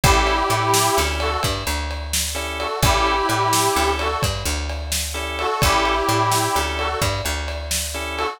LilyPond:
<<
  \new Staff \with { instrumentName = "Harmonica" } { \time 12/8 \key a \major \tempo 4. = 86 <e' g'>2~ <e' g'>8 <fis' a'>8 r2 r8 <fis' a'>8 | <e' g'>2~ <e' g'>8 <fis' a'>8 r2 r8 <fis' a'>8 | <e' g'>2~ <e' g'>8 <fis' a'>8 r2 r8 <fis' a'>8 | }
  \new Staff \with { instrumentName = "Drawbar Organ" } { \time 12/8 \key a \major <cis' e' g' a'>2 <cis' e' g' a'>2. <cis' e' g' a'>4 | <cis' e' g' a'>2 <cis' e' g' a'>2. <cis' e' g' a'>4 | <cis' e' g' a'>2 <cis' e' g' a'>2. <cis' e' g' a'>4 | }
  \new Staff \with { instrumentName = "Electric Bass (finger)" } { \clef bass \time 12/8 \key a \major a,,4 a,4 d,4 g,8 d,2~ d,8 | a,,4 a,4 d,4 g,8 d,2~ d,8 | a,,4 a,4 d,4 g,8 d,2~ d,8 | }
  \new DrumStaff \with { instrumentName = "Drums" } \drummode { \time 12/8 <bd cymr>8 cymr8 cymr8 sn8 cymr8 cymr8 <bd cymr>8 cymr8 cymr8 sn8 cymr8 cymr8 | <bd cymr>8 cymr8 cymr8 sn8 cymr8 cymr8 <bd cymr>8 cymr8 cymr8 sn8 cymr8 cymr8 | <bd cymr>8 cymr8 cymr8 sn8 cymr8 cymr8 <bd cymr>8 cymr8 cymr8 sn8 cymr8 cymr8 | }
>>